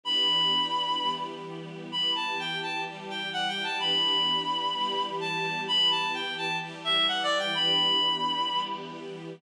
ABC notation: X:1
M:4/4
L:1/8
Q:1/4=128
K:Edor
V:1 name="Clarinet"
b5 z3 | b a g a z g (3f g a | b6 a2 | b a g a z e (3f d g |
b5 z3 |]
V:2 name="String Ensemble 1"
[E,B,DG]4 [E,G,B,G]4 | [E,B,G]4 [E,G,G]4 | [E,B,DG]4 [E,G,B,G]4 | [E,B,G]4 [E,G,G]4 |
[E,B,DG]4 [E,G,B,G]4 |]